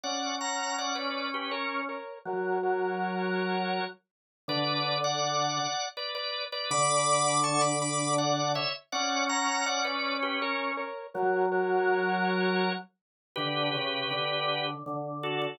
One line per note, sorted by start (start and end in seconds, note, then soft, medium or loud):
0.04 1.88 C#4 medium
0.04 0.36 D5 medium
0.04 0.36 F#5 medium
0.41 0.77 F#5 medium
0.41 0.77 A#5 medium
0.78 0.95 D5 medium
0.78 0.96 F#5 medium
0.95 1.28 B4 medium
0.95 1.28 D5 medium
1.34 1.52 G4 medium
1.34 1.52 B4 medium
1.51 1.81 A#4 medium
1.51 1.81 C#5 medium
1.89 2.19 A#4 medium
1.89 2.19 C#5 medium
2.25 3.80 F#3 medium
2.25 2.58 A#4 loud
2.25 2.58 C#5 loud
2.63 3.85 A#4 medium
2.63 3.85 C#5 medium
4.48 5.59 D3 loud
4.48 4.98 B4 loud
4.48 4.98 D5 loud
5.04 5.86 D5 medium
5.04 5.86 F#5 loud
5.97 6.14 B4 medium
5.97 6.14 D5 medium
6.15 6.45 B4 medium
6.15 6.45 D5 loud
6.52 6.70 B4 medium
6.52 6.70 D5 loud
6.71 8.57 D3 loud
6.71 7.40 B5 loud
6.71 7.40 D6 loud
7.44 7.61 A5 loud
7.44 7.61 C#6 loud
7.61 7.79 B5 medium
7.61 7.79 D6 loud
7.81 8.15 B5 medium
7.81 8.15 D6 loud
8.18 8.52 D5 medium
8.18 8.52 F#5 medium
8.55 8.73 C#5 loud
8.55 8.73 E5 loud
8.92 10.77 C#4 medium
8.92 9.25 D5 loud
8.92 9.25 F#5 loud
9.29 9.65 F#5 medium
9.29 9.65 A#5 loud
9.66 9.84 D5 medium
9.66 9.84 F#5 loud
9.85 10.17 B4 medium
9.85 10.17 D5 medium
10.23 10.40 G4 medium
10.23 10.40 B4 medium
10.42 10.72 A#4 medium
10.42 10.72 C#5 loud
10.77 11.07 A#4 loud
10.77 11.07 C#5 loud
11.14 12.69 F#3 loud
11.14 11.46 A#4 loud
11.14 11.46 C#5 loud
11.52 12.73 A#4 medium
11.52 12.73 C#5 loud
13.36 13.70 D3 medium
13.36 14.67 G4 loud
13.36 14.67 B4 loud
13.75 14.06 C#3 medium
14.11 14.75 D3 medium
14.86 15.47 D3 medium
15.23 15.41 F#4 medium
15.23 15.41 A4 medium
15.42 15.58 F#4 medium
15.42 15.58 A4 medium